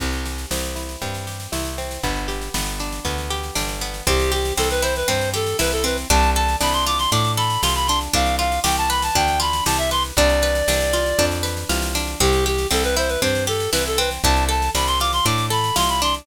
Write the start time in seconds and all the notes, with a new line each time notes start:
0.00 C2 C4, kick, snare, crash
0.13 snare
0.26 G4, snare
0.38 snare
0.51 C2 C4, snare
0.63 snare
0.76 E4, snare
0.89 snare
1.02 G2 C4, kick, snare
1.14 snare
1.27 G4, snare
1.40 snare
1.52 C2 E4, snare
1.65 snare
1.78 C4, snare
1.91 snare
2.03 G1 B3, kick, snare
2.16 snare
2.28 G4, snare
2.42 snare
2.54 G1 B3, snare
2.67 snare
2.80 D4, snare
2.92 snare
3.05 D2 B3, kick, snare
3.18 snare
3.30 G4, snare
3.43 snare
3.55 G1 D4, snare
3.69 snare
3.81 B3, snare
3.94 snare
4.07 C2 C4 G4, kick, snare
4.20 snare
4.32 G4, snare
4.45 snare
4.57 C2 C4 A4, snare
4.70 B4, snare
4.82 E4 C5, snare
4.96 B4, snare
5.08 G2 C4 C5, kick, snare
5.21 snare
5.34 G4 A4, snare
5.47 snare
5.59 C2 E4 B4, snare
5.72 A4, snare
5.84 C4 B4, snare
5.97 snare
6.10 C2 D4 A5, kick, snare
6.23 snare
6.35 A4 A5, snare
6.49 snare
6.60 C2 D4 B5, snare
6.73 C6, snare
6.86 F4 D6, snare
6.98 C6, snare
7.12 A2 D4 D6, kick, snare
7.24 snare
7.37 A4 B5, snare
7.50 snare
7.62 C2 F4 C6, snare
7.75 B5, snare
7.87 D4 C6, snare
8.01 snare
8.13 C2 D4 F5, kick, snare
8.26 snare
8.39 F4 F5, snare
8.52 snare
8.64 C2 G4 G5, snare
8.77 A5, snare
8.90 B4 B5, snare
9.02 A5, snare
9.15 D2 D4 G5, kick, snare
9.28 snare
9.40 F4 B5, snare
9.53 snare
9.66 C2 G4 A5, snare
9.78 E5, snare
9.91 B4 C6, snare
10.04 snare
10.17 C2 D4 D5, kick, snare
10.29 snare
10.42 B4, snare
10.55 snare
10.68 C2 D4, snare
10.80 snare
10.93 F4, snare
11.06 snare
11.19 F2 D4, kick, snare
11.31 snare
11.43 B4, snare
11.57 snare
11.69 C2 F4, snare
11.82 snare
11.95 D4, snare
12.07 snare
12.20 C2 C4 G4, kick, snare
12.33 snare
12.46 G4, snare
12.58 snare
12.71 C2 C4 A4, snare
12.84 B4, snare
12.96 E4 C5, snare
13.08 B4, snare
13.22 G2 C4 C5, kick, snare
13.35 snare
13.47 G4 A4, snare
13.60 snare
13.72 C2 E4 B4, snare
13.85 A4, snare
13.98 C4 B4, snare
14.11 snare
14.23 C2 D4 A5, kick, snare
14.36 snare
14.49 A4 A5, snare
14.62 snare
14.75 C2 D4 B5, snare
14.87 C6, snare
15.00 F4 D6, snare
15.13 C6, snare
15.25 A2 D4 D6, kick, snare
15.38 snare
15.50 A4 B5, snare
15.64 snare
15.76 C2 F4 C6, snare
15.89 B5, snare
16.02 D4 C6, snare
16.14 snare